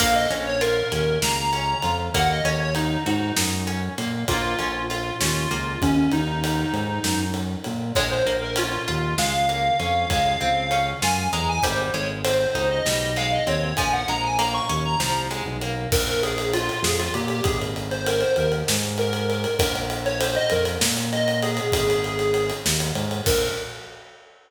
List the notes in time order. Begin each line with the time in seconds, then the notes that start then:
0.00 A#1 A#3 F5, kick, crash
0.15 D#5
0.30 A#1 C#4, ride
0.46 C#5
0.61 F4 A#4, ride
0.92 D#2 C#4, ride
1.22 C#2 A#3 A#5, snare
1.53 C#4, ride
1.82 F2 F4, ride
2.14 D#2 A#3 F#5, kick, ride
2.30 D#5
2.45 D#2 C#4 C#5, ride
2.60 C#5
2.75 D#4, ride
3.06 G#2 D#4 F#4, ride
3.36 F#2 D#4, snare
3.67 C#4, ride
3.98 A#2 A#3, ride
4.28 A#1 A#3 F4, kick, ride
4.59 A#1 C#4, ride
4.90 F4, ride
5.20 D#2 C#4 F4, snare
5.51 C#2 A#3, ride
5.82 D#2 C#4, kick, ride
5.96 C#4
6.11 D#2 D#4, ride
6.44 ride
6.73 G#2, ride
7.04 F#2, snare
7.34 ride
7.64 A#2, ride
7.95 A#1 G#3 C#5, kick, ride
8.10 C5
8.26 A#1 A#3, ride
8.42 A#4
8.56 C#4 F4, ride
8.88 D#2 F4, ride
9.18 C#2 G#3 F5, snare
9.49 A#3, ride
9.79 F2 C#4, ride
10.09 C#2 G#3 F5, kick, ride
10.41 C#2 C4, ride
10.71 C#4, ride
11.02 F#2 F4 G#5, snare
11.32 E2 G#3 A#5, ride
11.49 G#5
11.63 G#1 G3 C5, kick, ride
11.94 G#1 G#3 C#5, ride
12.24 C4 C5, ride
12.55 C#2 D#4, ride
12.70 D#5
12.86 B1 G3, snare
13.16 G#3 F5, ride
13.32 D#5
13.47 D#2 C4 C#5, ride
13.77 A#1 F3 G#5, kick, ride
13.92 F#5
14.08 A#1 G#3 A#5, ride
14.23 G#5
14.38 A#3 A#5, ride
14.54 C#6
14.69 D#2 C#4, ride
14.85 A#5
15.00 C2 F3, snare
15.31 G#3, ride
15.45 B1
15.61 A#3, ride
15.92 A#1 A#4, kick, crash
16.07 ride
16.23 G#4, ride
16.38 ride
16.53 F4, ride
16.69 ride
16.83 F2 G#4, snare
16.99 F4, ride
17.14 A#2 G4, ride
17.28 G4, ride
17.44 G#1 G#4, kick, ride
17.61 ride
17.76 ride
17.91 C5, ride
18.06 A#4, ride
18.21 C5, ride
18.36 D#2 A#4, ride
18.52 ride
18.68 G#2, snare
18.82 ride
18.98 A#4, ride
19.13 ride
19.29 A#4, ride
19.44 ride
19.58 A#1 A#4, kick, ride
19.76 ride
19.90 ride
20.05 C#5, ride
20.21 C5, ride
20.35 D#5, ride
20.50 F2 A#4, ride
20.65 ride
20.81 A#2, snare
20.97 ride
21.12 D#5, ride
21.28 ride
21.42 G#4, ride
21.57 ride
21.72 G#1 G#4, kick, ride
21.90 ride
22.04 ride
22.19 ride
22.34 ride
22.50 ride
22.66 D#2, snare
22.80 ride
22.95 G#2, ride
23.11 ride
23.26 A#1 A#4, kick, crash